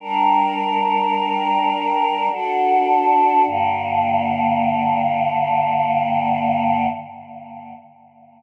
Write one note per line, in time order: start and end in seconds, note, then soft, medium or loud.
0.00 2.29 G3 medium
0.00 2.29 D4 medium
0.00 2.29 A#4 medium
2.30 3.44 D4 loud
2.30 3.44 F#4 loud
2.30 3.44 A4 medium
3.45 6.86 G2 loud
3.45 6.86 D3 loud
3.45 6.86 A#3 medium